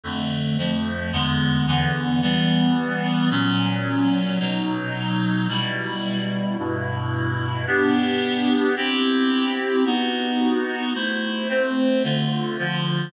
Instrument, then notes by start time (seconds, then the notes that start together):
clarinet
0.04 F2 D3 A3
0.58 F2 F3 A3
1.12 E2 D3 G#3 B3
1.67 E2 D3 E3 B3
2.22 E3 G3 B3
3.31 A#2 F#3 C#4
4.40 B2 F#3 D#4
5.49 B2 G3 E4
6.58 G2 B2 E4
7.67 B3 D4 G4
8.76 C4 E4 G4
9.85 B3 D#4 F#4
10.94 A3 E4 C5
11.49 A3 C4 C5
12.04 D3 A3 F4
12.58 D3 F3 F4